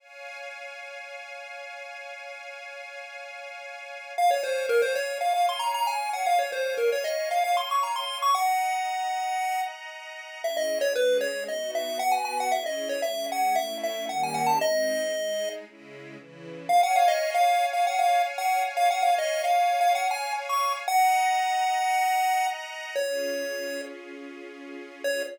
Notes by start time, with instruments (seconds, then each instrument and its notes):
0.00 string ensemble 1 C#5 F5 G#5
4.17 string ensemble 1 C#5 F5 G#5, lead 1 (square) F5
4.31 lead 1 (square) C#5
4.43 lead 1 (square) C5
4.69 lead 1 (square) A#4
4.82 lead 1 (square) C5
4.95 lead 1 (square) C#5
5.21 lead 1 (square) F5
5.34 lead 1 (square) F5
5.49 lead 1 (square) C6
5.59 lead 1 (square) A#5
5.74 lead 1 (square) A#5
5.87 lead 1 (square) G#5
6.13 lead 1 (square) F#5
6.26 lead 1 (square) F5
6.39 lead 1 (square) C#5
6.52 lead 1 (square) C5
6.77 lead 1 (square) A#4
6.92 lead 1 (square) C#5
7.04 lead 1 (square) D#5
7.31 lead 1 (square) F5
7.44 lead 1 (square) F5
7.57 lead 1 (square) C6
7.71 lead 1 (square) C#6
7.83 lead 1 (square) A#5
7.96 lead 1 (square) C6
8.22 lead 1 (square) C#6
8.34 string ensemble 1 D#5 F#5 A#5, lead 1 (square) F#5
10.43 string ensemble 1 C#4 E4 G#4, lead 1 (square) E5
10.57 lead 1 (square) D#5
10.81 lead 1 (square) C#5
10.95 string ensemble 1 G#3 C#4 G#4, lead 1 (square) B4
11.21 lead 1 (square) C#5
11.48 string ensemble 1 B3 D#4 F#4, lead 1 (square) D#5
11.75 lead 1 (square) E5
11.99 string ensemble 1 B3 F#4 B4, lead 1 (square) F#5
12.12 lead 1 (square) G#5
12.25 lead 1 (square) G#5
12.40 lead 1 (square) F#5
12.52 string ensemble 1 C#4 E4 G#4, lead 1 (square) E5
12.66 lead 1 (square) D#5
12.89 lead 1 (square) C#5
13.02 string ensemble 1 G#3 C#4 G#4, lead 1 (square) E5
13.32 lead 1 (square) F#5
13.56 string ensemble 1 A3 C#4 E4, lead 1 (square) E5
13.83 lead 1 (square) E5
14.09 string ensemble 1 D#3 G3 A#3 C#4, lead 1 (square) F#5
14.23 lead 1 (square) G#5
14.34 lead 1 (square) F#5
14.46 lead 1 (square) A5
14.61 string ensemble 1 G#3 C4 D#4, lead 1 (square) D#5
15.13 string ensemble 1 G#3 D#4 G#4
15.66 string ensemble 1 C#3 G#3 E4
16.17 string ensemble 1 C#3 E3 E4
16.69 string ensemble 1 C#5 F5 G#5, lead 1 (square) F5
16.83 lead 1 (square) F#5
16.96 lead 1 (square) F5
17.08 lead 1 (square) D#5
17.34 lead 1 (square) F5
17.73 lead 1 (square) F5
17.87 lead 1 (square) F#5
17.99 lead 1 (square) F5
18.38 lead 1 (square) F#5
18.77 lead 1 (square) F5
18.91 lead 1 (square) F#5
19.02 lead 1 (square) F5
19.18 lead 1 (square) D#5
19.44 lead 1 (square) F5
19.81 lead 1 (square) F5
19.95 lead 1 (square) F#5
20.11 lead 1 (square) G#5
20.49 lead 1 (square) C#6
20.87 string ensemble 1 D#5 F#5 A#5, lead 1 (square) F#5
22.96 string ensemble 1 C#4 F4 G#4, lead 1 (square) C#5
25.04 string ensemble 1 C#4 F4 G#4, lead 1 (square) C#5